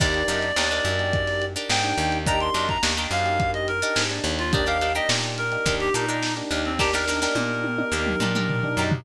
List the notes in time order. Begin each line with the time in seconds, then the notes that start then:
0.00 D#2 A#3 D4 D#4 G4 A#4 D5, kick, crash
0.14 closed hi-hat
0.28 F#2 D4 D#4 G4 A#4, snare, closed hi-hat
0.42 closed hi-hat
0.56 D#2 A#3 D4 D#4 G4 A#4, snare
0.71 D4 D#4 G4 A#4, closed hi-hat
0.85 F#2, closed hi-hat
0.99 A#3 D4 D#4 G4, closed hi-hat
1.13 kick, closed hi-hat
1.27 snare, closed hi-hat
1.42 closed hi-hat
1.56 D4 D#4 G4 A#4, closed hi-hat
1.69 G#2 G5, snare
1.84 A#3 D4 D#4 G4, closed hi-hat
1.98 D#2, closed hi-hat
2.12 closed hi-hat
2.26 A#3 D4 D#4 G4 A#4 A#5, kick, closed hi-hat
2.40 C6, closed hi-hat
2.54 F#2 D4 D#4 G4 A#4, snare, closed hi-hat
2.69 A#5, kick, closed hi-hat
2.83 D#2 A#3 D4 D#4 G4 A#4, snare
2.97 D4 D#4 G4 A#4, closed hi-hat
3.11 F#2 F5, closed hi-hat
3.25 A#3 D4 D#4 G4, closed hi-hat
3.40 kick, closed hi-hat
3.54 D#5, closed hi-hat
3.68 A#4, closed hi-hat
3.82 D4 D#4 G4 A#4, closed hi-hat
3.96 G#2, snare
4.10 A#3 D4 D#4 G4, closed hi-hat
4.24 D#2, closed hi-hat
4.39 F4, closed hi-hat
4.53 A#3 D4 D#4 G4 A#4 D5, kick, closed hi-hat
4.66 D4 D#4 G4 A#4 F5, closed hi-hat
4.81 D4 D#4 G4 A#4, snare, closed hi-hat
4.95 D4 D#4 G4 A#4 D#5, closed hi-hat
5.09 A#2 A#3 D4 D#4 G4, snare
5.24 closed hi-hat
5.38 A#4, closed hi-hat
5.52 A#3 D4 D#4 G4, closed hi-hat
5.66 D#2 D4 D#4 G4 A#4, kick, closed hi-hat
5.80 G4, closed hi-hat
5.94 A#2 D4 D#4 G4 A#4, closed hi-hat
6.08 D4 D#4 G4 A#4, closed hi-hat
6.23 snare
6.37 A#3 D4 D#4 G4, closed hi-hat
6.51 D#2 D4 D#4 G4 A#4, closed hi-hat
6.65 C4, closed hi-hat
6.79 A#3 D4 D#4 G4 A#4, kick, snare
6.93 D4 D#4 G4 A#4, snare
7.07 D4 D#4 G4 A#4, snare
7.22 D4 D#4 G4 A#4, snare
7.35 A#2 A#3 D4 D#4 G4, high tom
7.64 high tom
7.78 A#3 D4 D#4 G4, high tom
7.92 D#2 D4 D#4 G4 A#4
8.07 mid tom
8.20 A#2 D4 D#4 G4 A#4, mid tom
8.35 D4 D#4 G4 A#4, mid tom
8.49 floor tom
8.63 A#3 D4 D#4 G4, floor tom
8.77 F#2 D4 D#4 G4 A#4
8.92 floor tom